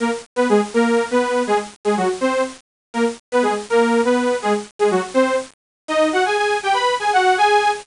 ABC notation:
X:1
M:6/8
L:1/8
Q:3/8=163
K:Ab
V:1 name="Lead 2 (sawtooth)"
[B,B] z2 [=B,=B] [A,A] z | [B,B]3 [=B,=B]3 | [A,A] z2 [A,A] [_G,_G] z | [Cc]2 z4 |
[B,B] z2 [=B,=B] [A,A] z | [B,B]3 [=B,=B]3 | [A,A] z2 [A,A] [_G,_G] z | [Cc]2 z4 |
[Ee]2 [_G_g] [Aa] [Aa]2 | [Gg] [=B=b]2 [Aa] [_G_g]2 | [Aa]3 z3 |]